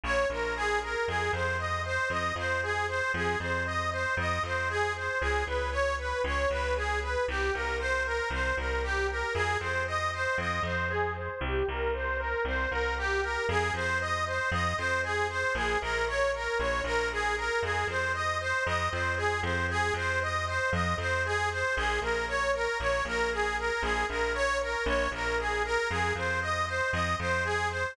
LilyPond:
<<
  \new Staff \with { instrumentName = "Harmonica" } { \time 4/4 \key f \minor \partial 2 \tempo 4 = 116 des''8 bes'8 aes'8 bes'8 | aes'8 c''8 ees''8 c''8 ees''8 c''8 aes'8 c''8 | aes'8 c''8 ees''8 c''8 ees''8 c''8 aes'8 c''8 | aes'8 ces''8 des''8 ces''8 des''8 ces''8 aes'8 ces''8 |
g'8 bes'8 c''8 bes'8 c''8 bes'8 g'8 bes'8 | aes'8 c''8 ees''8 c''8 ees''8 c''8 aes'8 c''8 | g'8 bes'8 c''8 bes'8 c''8 bes'8 g'8 bes'8 | aes'8 c''8 ees''8 c''8 ees''8 c''8 aes'8 c''8 |
aes'8 bes'8 des''8 bes'8 des''8 bes'8 aes'8 bes'8 | aes'8 c''8 ees''8 c''8 ees''8 c''8 aes'8 c''8 | aes'8 c''8 ees''8 c''8 ees''8 c''8 aes'8 c''8 | aes'8 bes'8 des''8 bes'8 des''8 bes'8 aes'8 bes'8 |
aes'8 bes'8 des''8 bes'8 des''8 bes'8 aes'8 bes'8 | aes'8 c''8 ees''8 c''8 ees''8 c''8 aes'8 c''8 | }
  \new Staff \with { instrumentName = "Electric Bass (finger)" } { \clef bass \time 4/4 \key f \minor \partial 2 bes,,8 bes,,4. | f,8 f,4. f,8 f,4. | f,8 f,4. f,8 f,4. | des,8 des,4. des,8 des,4. |
c,8 c,4. c,8 c,4. | f,8 f,4. f,8 f,4. | c,8 c,4. c,8 c,4. | f,8 f,4. f,8 f,4. |
bes,,8 bes,,4. bes,,8 bes,,4. | f,8 f,4. f,8 f,4 f,8~ | f,8 f,4. f,8 f,4. | bes,,8 bes,,4. bes,,8 bes,,4. |
bes,,8 bes,,4. bes,,8 bes,,4. | f,8 f,4. f,8 f,4. | }
>>